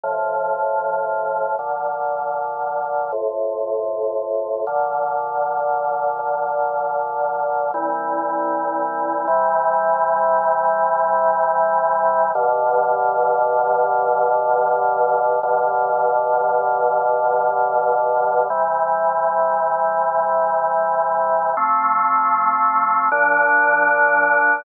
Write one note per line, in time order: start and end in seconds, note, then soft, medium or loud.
0.04 1.56 A2 medium
0.04 1.56 C3 medium
0.04 1.56 F3 medium
1.59 3.11 A#2 medium
1.59 3.11 D3 medium
1.59 3.11 F3 medium
3.12 4.65 F2 medium
3.12 4.65 A2 medium
3.12 4.65 C3 medium
4.67 6.18 A#2 medium
4.67 6.18 D3 medium
4.67 6.18 F3 medium
6.19 7.71 A#2 medium
6.19 7.71 D3 medium
6.19 7.71 F3 medium
7.74 9.26 C2 medium
7.74 9.26 A#2 medium
7.74 9.26 E3 medium
7.74 9.26 G3 medium
9.27 12.32 C3 loud
9.27 12.32 E3 medium
9.27 12.32 G3 loud
12.35 15.40 G2 medium
12.35 15.40 B2 medium
12.35 15.40 D3 medium
12.35 15.40 F3 medium
15.43 18.48 G2 medium
15.43 18.48 B2 medium
15.43 18.48 D3 medium
15.43 18.48 F3 medium
18.50 21.54 C3 medium
18.50 21.54 E3 medium
18.50 21.54 G3 medium
21.57 23.09 F3 medium
21.57 23.09 A3 medium
21.57 23.09 C4 medium
23.12 24.64 A#2 medium
23.12 24.64 F3 loud
23.12 24.64 D4 medium